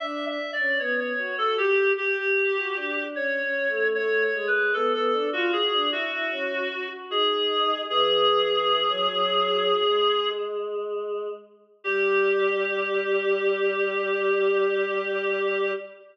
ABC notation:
X:1
M:5/4
L:1/16
Q:1/4=76
K:Glyd
V:1 name="Clarinet"
(3e2 e2 d2 c c2 A G2 G6 c4 | (3c2 c2 B2 A A2 F ^G2 F6 _A4 | ^G14 z6 | G20 |]
V:2 name="Choir Aahs"
D2 z C B,2 F2 G2 G G2 F D2 (3C2 C2 A,2 | A,2 ^G,2 B, B, D ^E F D =E E _D2 _G G _E4 | E,2 E,3 F, F,4 ^G,8 z2 | G,20 |]